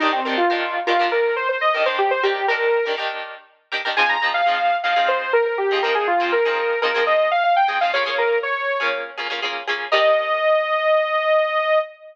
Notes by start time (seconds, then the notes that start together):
0.00 D#3 D4 D#4 G4 A#4
0.12 C4
0.25 D#3 D4 G4 A#4
0.37 F4
0.50 D#3 D4 G4 A#4
0.87 D#3 D4 F4 G4 A#4
0.99 D#3 D4 G4 A#4
1.12 A#4
1.36 C5
1.49 C5
1.61 D#5
1.74 D#3 D4 G4 A#4
1.85 D#3 D4 G4 A#4 C5
1.98 G4
2.11 C5
2.23 D#3 D4 G4 A#4
2.48 D#3 D4 G4 A#4
2.85 D#3 D4 G4 A#4
2.97 D#3 D4 G4 A#4
3.71 D#3 D4 G4 A#4
3.85 D#3 D4 G4 A#4
3.97 F3 C4 D#4 G#4 G#5
4.09 A#5
4.21 F3 C4 D#4 G#4
4.34 F5
4.46 F3 C4 D#4 G#4
4.83 F3 C4 D#4 G#4 F5
4.96 F3 C4 D#4 G#4
5.08 C5
5.33 A#4
5.46 A#4
5.58 G4
5.71 F3 C4 D#4 G#4
5.82 F3 C4 D#4 G#4 A#4
5.95 G#4
6.07 F4
6.20 F3 C4 D#4 G#4
6.32 A#4
6.45 F3 C4 D#4 G#4
6.82 F3 C4 D#4 G#4 A#4
6.94 F3 C4 D#4 G#4
7.07 D#5
7.31 F5
7.44 F5
7.56 G5
7.68 F3 C4 D#4 G#4
7.81 F3 C4 D#4 G#4 F5
7.93 A#3 C#4 F4 G#4 C#5
8.05 A#3 C#4 F4 G#4
8.18 A#4
8.43 C#5
8.80 A#3 C#4 F4 G#4
9.17 A#3 C#4 F4 G#4
9.30 A#3 C#4 F4 G#4
9.42 A#3 C#4 F4 G#4
9.67 A#3 C#4 F4 G#4
9.92 D#3 D4 G4 A#4 D#5